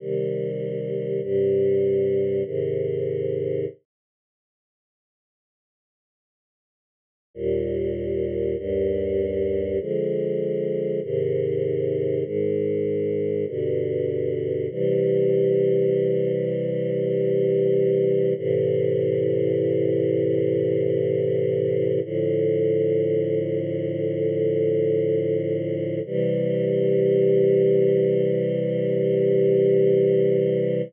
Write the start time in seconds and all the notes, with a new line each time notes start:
0.00 C3 D#3 G3
1.22 G2 C3 G3
2.45 G#2 C3 D#3
7.34 D#2 A#2 G3
8.57 D#2 G2 G3
9.79 D3 F3 G#3
11.02 G#2 C3 D#3
12.24 G#2 D#3 G#3
13.47 G2 B2 D3
14.70 C3 E3 G3
18.36 A2 C3 E3
22.04 A2 D3 F3
26.06 C3 E3 G3